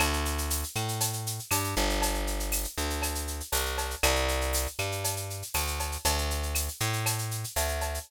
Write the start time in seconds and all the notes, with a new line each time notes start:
0.00 D2, cowbell, claves, shaker
0.13 shaker
0.25 shaker
0.38 shaker
0.50 tambourine, shaker
0.63 shaker
0.75 A2, claves, shaker
0.88 shaker
1.00 cowbell, shaker
1.13 shaker
1.26 shaker
1.39 shaker
1.51 G2, tambourine, cowbell, claves, shaker
1.64 shaker
1.76 G1, cowbell, shaker
1.89 shaker
2.02 cowbell, shaker
2.14 shaker
2.27 shaker
2.40 shaker
2.52 tambourine, claves, shaker
2.64 shaker
2.78 D2, shaker
2.90 shaker
3.02 cowbell, claves, shaker
3.15 shaker
3.27 shaker
3.40 shaker
3.52 C2, tambourine, cowbell, shaker
3.66 shaker
3.78 cowbell, shaker
3.90 shaker
4.03 C2, cowbell, claves, shaker
4.16 shaker
4.28 shaker
4.41 shaker
4.53 tambourine, shaker
4.67 shaker
4.79 G2, claves, shaker
4.92 shaker
5.04 cowbell, shaker
5.16 shaker
5.30 shaker
5.42 shaker
5.54 D2, tambourine, cowbell, claves, shaker
5.67 shaker
5.79 cowbell, shaker
5.92 shaker
6.05 D2, cowbell, shaker
6.18 shaker
6.30 shaker
6.43 shaker
6.55 tambourine, claves, shaker
6.68 shaker
6.80 A2, shaker
6.93 shaker
7.06 cowbell, claves, shaker
7.18 shaker
7.31 shaker
7.44 shaker
7.56 D2, tambourine, cowbell, shaker
7.68 shaker
7.81 cowbell, shaker
7.94 shaker